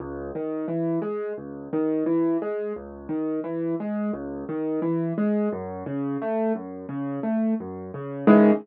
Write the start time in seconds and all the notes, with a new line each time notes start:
0.00 C#2
0.35 D#3
0.68 E3
1.02 G#3
1.37 C#2
1.73 D#3
2.06 E3
2.42 G#3
2.76 C#2
3.09 D#3
3.44 E3
3.80 G#3
4.14 C#2
4.49 D#3
4.82 E3
5.18 G#3
5.52 F#2
5.86 C#3
6.22 A3
6.55 F#2
6.89 C#3
7.23 A3
7.60 F#2
7.94 C#3
8.27 C#2 D#3 E3 G#3